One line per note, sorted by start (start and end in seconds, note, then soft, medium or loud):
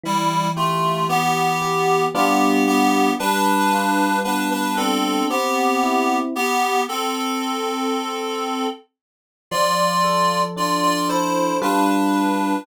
0.04 2.04 E3 medium
0.04 0.48 G3 loud
0.04 0.48 E4 loud
0.56 1.05 A3 medium
0.56 1.05 F4 medium
0.56 1.61 G4 medium
1.09 2.03 B3 loud
1.09 2.09 B3 medium
1.09 2.03 G4 loud
1.62 2.12 G4 medium
2.14 3.09 G3 medium
2.14 3.09 B3 loud
2.14 2.64 B3 loud
2.14 3.09 D4 loud
2.14 3.09 F4 loud
2.14 2.64 G4 loud
2.67 3.10 B3 loud
2.67 3.10 G4 loud
3.19 5.20 G3 medium
3.19 4.17 D4 loud
3.19 4.17 B4 loud
3.72 5.22 F4 medium
4.24 5.25 B3 medium
4.24 4.49 D4 loud
4.24 4.49 B4 loud
4.51 4.76 D4 medium
4.51 4.76 B4 loud
4.77 5.24 C4 medium
4.77 5.28 D4 medium
4.77 5.24 A4 loud
5.30 6.16 B3 loud
5.30 6.30 C4 medium
5.30 6.16 G4 loud
5.83 6.33 E4 medium
6.36 6.81 B3 loud
6.36 6.81 G4 loud
6.89 8.64 C4 medium
6.89 8.64 A4 loud
9.51 11.51 F3 loud
9.51 10.40 F4 loud
9.51 10.40 D5 loud
10.04 11.09 A4 medium
10.56 11.56 D4 medium
10.56 10.82 F4 medium
10.56 10.82 D5 loud
10.83 11.08 F4 loud
10.83 11.08 D5 loud
11.09 11.56 E4 medium
11.09 11.59 A4 medium
11.09 11.56 C5 medium
11.62 12.56 G3 medium
11.62 12.56 D4 loud
11.62 12.62 D4 medium
11.62 12.56 F4 loud
11.62 12.56 B4 medium
11.62 12.62 B4 loud